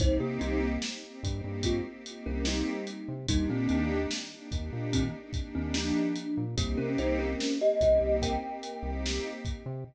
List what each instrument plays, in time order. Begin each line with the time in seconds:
0.00 synth bass 1 C2, pad 2 (warm) A#3 C4 D#4 G4, kalimba D#4 C5, kick, closed hi-hat
0.20 synth bass 1 C3, kalimba A#3 G4
0.41 synth bass 1 C2, kalimba G3 D#4, closed hi-hat
0.82 snare
1.02 pad 2 (warm) A#3 C4 D#4 G4
1.23 synth bass 1 G2, pad 2 (warm) A#3 C4 D#4 G4, kick, closed hi-hat
1.44 synth bass 1 G2
1.63 kalimba G#3 F4, kick, closed hi-hat
1.85 pad 2 (warm) A#3 C4 D#4 G4
2.06 pad 2 (warm) A#3 C4 D#4 G4, closed hi-hat
2.26 synth bass 1 C2, kalimba C#4 A#4
2.45 kalimba G3 D#4, snare
2.87 closed hi-hat
3.08 synth bass 1 C3
3.28 synth bass 1 D#2, kalimba G3 D#4, pad 2 (warm) A#3 D4 D#4 G4, kick, closed hi-hat
3.49 synth bass 1 A#2, kalimba D#3 C4
3.69 synth bass 1 D#2, kalimba D#3 C4, closed hi-hat
4.11 snare
4.31 pad 2 (warm) A#3 D4 D#4 G4
4.52 synth bass 1 D#2, pad 2 (warm) A#3 D4 D#4 G4, kick, closed hi-hat
4.73 synth bass 1 A#2
4.93 kalimba D#3 C4, kick, closed hi-hat
5.14 pad 2 (warm) A#3 D4 D#4 G4
5.33 pad 2 (warm) A#3 D4 D#4 G4, kick, closed hi-hat
5.55 synth bass 1 D#2, kalimba D#3 C4
5.74 kalimba F3 D4, snare
6.16 closed hi-hat
6.37 synth bass 1 A#2
6.57 synth bass 1 C2, kalimba A#3 G4, pad 2 (warm) A#3 C4 D#4 G4, kick, closed hi-hat
6.77 synth bass 1 C3, kalimba C#4 A#4
6.98 synth bass 1 C2, kalimba D#4 C5, closed hi-hat
7.19 kalimba C#4 A#4
7.40 snare
7.61 pad 2 (warm) A#3 C4 D#4 G4, kalimba G4 D#5
7.81 synth bass 1 C2, pad 2 (warm) A#3 C4 D#4 G4, kalimba G4 D#5, kick, closed hi-hat
8.01 synth bass 1 C2
8.22 kalimba A#4 G5, kick, closed hi-hat
8.42 pad 2 (warm) A#3 C4 D#4 G4
8.63 pad 2 (warm) A#3 C4 D#4 G4, closed hi-hat
8.83 synth bass 1 C2
9.06 snare
9.45 kick, closed hi-hat
9.66 synth bass 1 C3